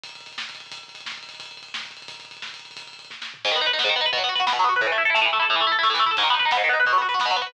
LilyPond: <<
  \new Staff \with { instrumentName = "Overdriven Guitar" } { \time 6/8 \key gis \phrygian \tempo 4. = 176 r2. | r2. | r2. | r2. |
r2. | gis,16 dis16 b16 dis'16 b'16 dis'16 b16 gis,16 dis16 b16 dis'16 b'16 | b,16 fis16 b16 fis'16 b'16 fis'16 b16 b,16 fis16 b16 fis'16 b'16 | a,16 e16 a16 e'16 a'16 e'16 a16 a,16 e16 a16 e'16 a'16 |
a,16 e16 a16 e'16 a'16 e'16 a16 a,16 e16 a16 e'16 a'16 | gis,16 dis16 b16 dis'16 b'16 dis'16 b16 gis,16 dis16 b16 dis'16 b'16 | b,16 fis16 b16 fis'16 b'16 fis'16 b16 b,16 fis16 b16 fis'16 b'16 | }
  \new DrumStaff \with { instrumentName = "Drums" } \drummode { \time 6/8 <hh bd>16 <hh bd>16 <hh bd>16 <hh bd>16 <hh bd>16 <hh bd>16 <bd sn>16 <hh bd>16 <hh bd>16 <hh bd>16 <hh bd>16 <hh bd>16 | <hh bd>16 <hh bd>16 <hh bd>16 <hh bd>16 <hh bd>16 <hh bd>16 <bd sn>16 <hh bd>16 <hh bd>16 <hh bd>16 <hh bd>16 <hh bd>16 | <hh bd>16 <hh bd>16 <hh bd>16 <hh bd>16 <hh bd>16 <hh bd>16 <bd sn>16 <hh bd>16 <hh bd>16 <hh bd>16 <hh bd>16 <hh bd>16 | <hh bd>16 <hh bd>16 <hh bd>16 <hh bd>16 <hh bd>16 <hh bd>16 <bd sn>16 <hh bd>16 <hh bd>16 <hh bd>16 <hh bd>16 <hh bd>16 |
<hh bd>16 <hh bd>16 <hh bd>16 <hh bd>16 <hh bd>16 <hh bd>16 <bd sn>8 sn8 tomfh8 | <cymc bd>16 bd16 <bd tomfh>16 bd16 <bd tomfh>16 bd16 <bd sn>16 bd16 <bd tomfh>16 bd16 <bd tomfh>16 bd16 | <bd tomfh>16 bd16 <bd tomfh>16 bd16 <bd tomfh>16 bd16 <bd sn>16 bd16 <bd tomfh>16 bd16 <bd tomfh>16 bd16 | <bd tomfh>16 bd16 <bd tomfh>16 bd16 <bd tomfh>16 bd16 <bd sn>16 bd16 <bd tomfh>16 bd16 <bd tomfh>16 bd16 |
<bd tomfh>16 bd16 <bd tomfh>16 bd16 <bd tomfh>16 bd16 <bd sn>8 sn8 tomfh8 | <cymc bd>16 bd16 <bd tomfh>16 bd16 <bd tomfh>16 bd16 <bd sn>16 bd16 <bd tomfh>16 bd16 <bd tomfh>16 bd16 | <bd tomfh>16 bd16 <bd tomfh>16 bd16 <bd tomfh>16 bd16 <bd sn>16 bd16 <bd tomfh>16 bd16 <bd tomfh>16 bd16 | }
>>